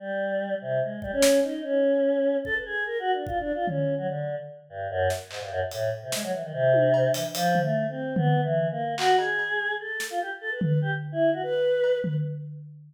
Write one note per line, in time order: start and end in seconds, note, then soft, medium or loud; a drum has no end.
0.00 0.55 G3 medium
0.61 0.80 C3 medium
0.82 1.00 G#3 soft
1.02 1.11 G3 medium
1.02 kick medium
1.12 1.40 C#4 loud
1.22 snare loud
1.43 1.61 D#4 medium
1.63 2.37 C#4 medium
2.45 2.54 A4 loud
2.45 kick medium
2.55 2.64 B4 medium
2.65 2.84 G#4 medium
2.86 2.98 A#4 medium
2.99 3.12 F#4 loud
3.13 3.25 D4 medium
3.27 3.39 F4 medium
3.27 kick medium
3.40 3.52 D4 loud
3.54 3.66 F4 medium
3.67 3.95 C#4 medium
3.67 floor tom medium
3.98 4.07 F#3 medium
4.08 4.35 D3 medium
4.69 4.88 G2 medium
4.90 5.08 F#2 loud
5.10 snare medium
5.30 5.40 G#2 medium
5.30 clap medium
5.41 5.50 G2 medium
5.51 5.60 F#2 loud
5.71 5.90 A2 medium
5.71 closed hi-hat medium
6.02 6.11 C3 medium
6.12 6.22 G#3 medium
6.12 snare medium
6.23 6.32 F#3 medium
6.32 6.42 E3 medium
6.43 6.52 D#3 medium
6.53 7.08 C3 loud
6.73 high tom medium
6.94 cowbell medium
7.14 7.23 E3 medium
7.14 closed hi-hat medium
7.35 7.59 F3 loud
7.35 closed hi-hat medium
7.55 floor tom medium
7.62 7.86 A3 medium
7.89 8.14 C4 medium
8.16 8.41 B3 medium
8.16 floor tom loud
8.43 8.68 E3 medium
8.71 8.95 A#3 medium
8.98 9.16 F#4 loud
8.98 clap loud
9.18 9.73 G#4 medium
9.18 cowbell medium
9.39 cowbell medium
9.80 10.07 A4 medium
10.00 snare medium
10.10 10.19 F4 loud
10.20 10.30 G4 medium
10.41 10.50 A4 medium
10.51 10.60 B4 medium
10.61 10.79 B4 medium
10.61 floor tom loud
10.82 10.91 G4 medium
11.12 11.30 E4 loud
11.33 11.42 F#4 medium
11.43 11.98 B4 loud
11.84 cowbell medium
12.04 12.13 B4 medium
12.04 floor tom loud